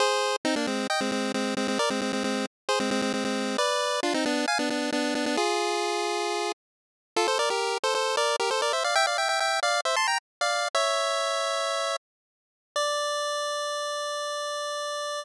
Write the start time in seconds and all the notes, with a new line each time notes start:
0.00 G#4 C5
0.45 C4 D#4
0.56 A#3 D4
0.67 G#3 C4
0.90 D#5 G5
1.01 G#3 C4
1.12 G#3 C4
1.34 G#3 C4
1.57 G#3 C4
1.68 G#3 C4
1.79 A#4 D5
1.90 G#3 C4
2.01 G#3 C4
2.13 G#3 C4
2.24 G#3 C4
2.69 G#4 C5
2.80 G#3 C4
2.91 G#3 C4
3.02 G#3 C4
3.14 G#3 C4
3.25 G#3 C4
3.58 B4 D5
4.03 D4 F4
4.14 C4 D#4
4.26 B3 D4
4.48 F5 G#5
4.59 B3 D4
4.70 B3 D4
4.92 B3 D4
5.15 B3 D4
5.26 B3 D4
5.37 F4 G#4
7.16 F4 A4
7.28 A4 C5
7.39 A#4 D5
7.50 G4 A#4
7.84 A4 C5
7.95 A4 C5
8.17 A#4 D5
8.40 G4 A#4
8.51 A4 C5
8.62 A#4 D5
8.73 C5 E5
8.84 D5 F5
8.95 E5 G5
9.07 D5 F5
9.18 E5 G5
9.29 E5 G5
9.40 E5 G5
9.63 D5 F5
9.85 C5 E5
9.96 A5 C6
10.07 G5 A#5
10.41 D5 F5
10.75 C#5 E5
12.76 D5